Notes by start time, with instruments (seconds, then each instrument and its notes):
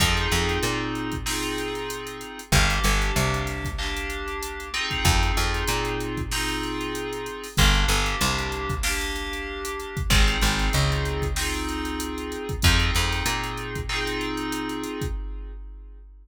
0.00 electric bass (finger) F2, electric piano 2 C4 D#4 F4 G#4, kick, closed hi-hat
0.17 closed hi-hat
0.32 electric bass (finger) F2, closed hi-hat
0.49 closed hi-hat
0.63 electric bass (finger) A#2, closed hi-hat
0.95 closed hi-hat
1.12 kick, closed hi-hat
1.26 electric piano 2 C4 D#4 F4 G#4, snare
1.43 closed hi-hat
1.58 closed hi-hat
1.75 closed hi-hat
1.90 closed hi-hat
2.07 closed hi-hat
2.21 closed hi-hat
2.39 closed hi-hat
2.52 electric bass (finger) G1, electric piano 2 A#3 D4 G4, kick, closed hi-hat
2.70 snare, closed hi-hat
2.84 electric bass (finger) G1, closed hi-hat
3.02 closed hi-hat
3.16 electric bass (finger) C2, closed hi-hat
3.34 closed hi-hat
3.47 snare, closed hi-hat
3.65 kick, closed hi-hat
3.78 electric piano 2 A#3 D4 G4, clap
3.97 closed hi-hat
4.10 closed hi-hat
4.28 closed hi-hat
4.43 closed hi-hat
4.60 closed hi-hat
4.74 electric piano 2 C4 D#4 F4 G#4, closed hi-hat
4.91 kick, closed hi-hat
5.05 electric bass (finger) F2, kick, closed hi-hat
5.23 closed hi-hat
5.37 electric bass (finger) F2, closed hi-hat
5.54 closed hi-hat
5.68 electric bass (finger) A#2, closed hi-hat
5.85 closed hi-hat
6.00 closed hi-hat
6.17 kick, closed hi-hat
6.31 electric piano 2 C4 D#4 F4 G#4, snare
6.49 closed hi-hat
6.63 closed hi-hat
6.81 closed hi-hat
6.95 closed hi-hat
7.13 closed hi-hat
7.26 closed hi-hat
7.44 open hi-hat
7.57 electric bass (finger) G1, electric piano 2 A#3 D4 G4, kick, closed hi-hat
7.74 closed hi-hat
7.88 electric bass (finger) G1, closed hi-hat
8.06 closed hi-hat
8.21 electric bass (finger) C2, closed hi-hat
8.39 closed hi-hat
8.52 closed hi-hat
8.69 kick, closed hi-hat
8.83 electric piano 2 A#3 D4 G4, snare
9.01 closed hi-hat
9.16 closed hi-hat
9.33 closed hi-hat
9.65 closed hi-hat
9.80 closed hi-hat
9.97 kick, closed hi-hat
10.10 electric bass (finger) G#1, electric piano 2 C4 D#4 F4 G#4, kick, closed hi-hat
10.28 closed hi-hat
10.41 electric bass (finger) G#1, closed hi-hat
10.59 snare, closed hi-hat
10.73 electric bass (finger) C#2, closed hi-hat
10.92 closed hi-hat
11.05 closed hi-hat
11.22 kick, closed hi-hat
11.36 electric piano 2 C4 D#4 F4 G#4, snare
11.54 closed hi-hat
11.69 closed hi-hat
11.85 closed hi-hat
12.00 closed hi-hat
12.18 closed hi-hat
12.32 closed hi-hat
12.49 kick, closed hi-hat
12.62 electric bass (finger) F2, electric piano 2 C4 D#4 F4 G#4, kick, closed hi-hat
12.79 closed hi-hat
12.95 electric bass (finger) F2, closed hi-hat
13.13 snare, closed hi-hat
13.26 electric bass (finger) A#2, closed hi-hat
13.44 closed hi-hat
13.58 closed hi-hat
13.75 kick, closed hi-hat
13.89 electric piano 2 C4 D#4 F4 G#4, clap
14.07 closed hi-hat
14.21 closed hi-hat
14.37 closed hi-hat
14.52 closed hi-hat
14.69 closed hi-hat
14.84 closed hi-hat
15.01 kick, closed hi-hat